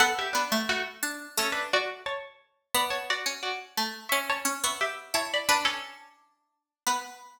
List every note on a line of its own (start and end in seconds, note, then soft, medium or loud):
0.00 0.33 B3 loud
0.00 0.13 A4 loud
0.00 0.13 F#5 loud
0.19 0.34 G4 medium
0.19 0.34 E5 loud
0.33 0.49 B3 medium
0.33 0.64 D4 medium
0.33 0.64 B4 medium
0.52 1.00 A3 loud
0.69 0.83 A3 loud
0.69 0.83 F#4 loud
1.03 1.32 D4 medium
1.37 2.18 A3 medium
1.37 1.53 C#4 loud
1.37 1.53 A4 loud
1.52 1.68 D4 medium
1.52 1.68 B4 loud
1.73 2.01 F#4 loud
1.73 2.01 D5 loud
2.06 2.22 C#5 medium
2.06 2.22 A5 loud
2.74 3.16 B3 loud
2.74 2.89 D5 loud
2.74 2.89 B5 loud
2.90 3.05 C#5 medium
2.90 3.05 A5 loud
3.10 3.42 F#4 medium
3.10 3.42 D5 loud
3.26 3.74 C#4 medium
3.43 3.59 F#4 medium
3.43 3.59 D5 loud
3.77 4.07 A3 medium
4.09 4.44 C#4 loud
4.09 4.24 E5 medium
4.09 4.24 C#6 loud
4.30 4.62 C#5 medium
4.30 4.62 A5 loud
4.45 4.60 C#4 medium
4.64 5.08 B3 medium
4.64 4.80 E5 medium
4.64 4.80 C#6 medium
4.81 5.11 G4 medium
4.81 5.11 E5 medium
5.14 5.42 E4 medium
5.14 5.29 C#5 medium
5.14 5.29 A5 loud
5.34 5.50 D5 medium
5.34 5.50 B5 loud
5.49 5.65 D4 loud
5.49 6.08 D4 loud
5.49 5.65 B4 loud
5.65 6.09 C#4 medium
5.65 6.09 A4 loud
6.87 6.99 B3 loud
6.87 7.00 B4 loud